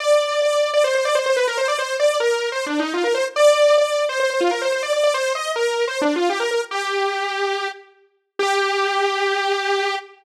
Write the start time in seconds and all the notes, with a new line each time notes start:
0.00 D5
0.42 D5
0.73 D5
0.84 C5
0.94 C5
1.05 D5
1.15 C5
1.26 C5
1.36 B4
1.47 A#4
1.57 C5
1.68 D5
1.78 C5
1.99 D5
2.20 A#4
2.52 C5
2.66 D4
2.79 D#4
2.94 F4
3.04 A#4
3.14 C5
3.36 D5
3.78 D5
4.09 C5
4.20 C5
4.30 C5
4.40 F4
4.51 A#4
4.61 C5
4.72 C5
4.83 D5
4.93 D5
5.03 D5
5.14 C5
5.35 D#5
5.56 A#4
5.87 C5
6.01 D4
6.16 F4
6.29 G4
6.40 A#4
6.51 A#4
6.71 G4
8.39 G4